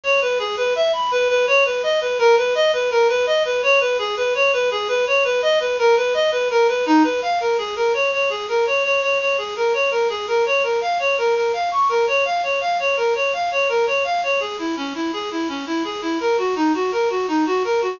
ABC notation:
X:1
M:5/4
L:1/8
Q:1/4=167
K:C#m
V:1 name="Clarinet"
c B G B e b B B c B | d B ^A B d B A B d B | c B G B c B G B c B | d B ^A B d B A B D B |
[K:Bbm] f B A B d d A B d d | d d A B d B A B d B | f d B B f d' B d f d | f d B d f d B d f d |
[K:C#m] G E C E G E C E G E | ^A F D F A F D F A F |]